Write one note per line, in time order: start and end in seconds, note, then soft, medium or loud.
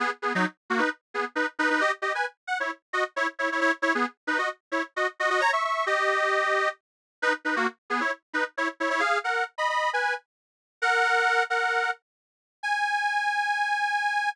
0.00 0.10 B3 medium
0.00 0.10 G#4 medium
0.22 0.33 B3 medium
0.22 0.33 G#4 medium
0.35 0.45 F#3 medium
0.35 0.45 D#4 loud
0.70 0.80 A#3 medium
0.70 0.80 F#4 medium
0.79 0.89 D#4 medium
0.79 0.89 B4 medium
1.14 1.25 B3 medium
1.14 1.25 G#4 medium
1.35 1.46 D#4 medium
1.35 1.46 B4 medium
1.59 1.69 D#4 medium
1.59 1.69 B4 loud
1.70 1.81 D#4 medium
1.70 1.81 B4 loud
1.81 1.91 G4 medium
1.81 1.91 D#5 loud
2.02 2.13 G4 medium
2.02 2.13 D#5 medium
2.15 2.25 B4 medium
2.15 2.25 G#5 medium
2.47 2.58 F#5 medium
2.60 2.71 E4 medium
2.60 2.71 C#5 medium
2.93 3.04 F#4 medium
2.93 3.04 D#5 medium
3.16 3.27 E4 medium
3.16 3.27 C#5 medium
3.39 3.49 E4 medium
3.39 3.49 C#5 medium
3.52 3.60 E4 medium
3.52 3.60 C#5 medium
3.61 3.72 E4 medium
3.61 3.72 C#5 loud
3.82 3.93 E4 medium
3.82 3.93 C#5 loud
3.95 4.06 B3 medium
3.95 4.06 G#4 medium
4.27 4.38 D#4 medium
4.27 4.38 B4 medium
4.38 4.49 F#4 medium
4.38 4.49 D#5 medium
4.72 4.82 E4 medium
4.72 4.82 C#5 medium
4.96 5.07 F#4 medium
4.96 5.07 D#5 medium
5.20 5.29 F#4 medium
5.20 5.29 D#5 medium
5.30 5.41 F#4 medium
5.30 5.41 D#5 loud
5.41 5.51 C#5 loud
5.41 5.51 A#5 loud
5.53 5.63 E5 medium
5.53 5.63 C#6 medium
5.64 5.85 E5 medium
5.64 5.85 C#6 medium
5.86 6.69 G4 medium
5.86 6.69 D#5 medium
7.22 7.33 D#4 loud
7.22 7.33 B4 loud
7.45 7.55 D#4 medium
7.45 7.55 B4 medium
7.56 7.67 A#3 medium
7.56 7.67 F#4 medium
7.90 8.00 B3 medium
7.90 8.00 G#4 medium
8.00 8.11 E4 medium
8.00 8.11 C#5 medium
8.33 8.44 D#4 medium
8.33 8.44 B4 medium
8.57 8.68 E4 medium
8.57 8.68 C#5 medium
8.80 8.89 E4 medium
8.80 8.89 C#5 medium
8.90 9.01 E4 medium
8.90 9.01 C#5 loud
9.00 9.18 G#4 medium
9.00 9.18 F5 loud
9.24 9.44 A#4 medium
9.24 9.44 F#5 medium
9.58 9.69 D#5 medium
9.58 9.69 B5 medium
9.69 9.90 D#5 medium
9.69 9.90 B5 medium
9.93 10.14 B4 medium
9.93 10.14 G#5 medium
10.82 11.43 A#4 medium
10.82 11.43 F#5 loud
11.50 11.90 A#4 medium
11.50 11.90 F#5 medium
12.63 14.29 G#5 loud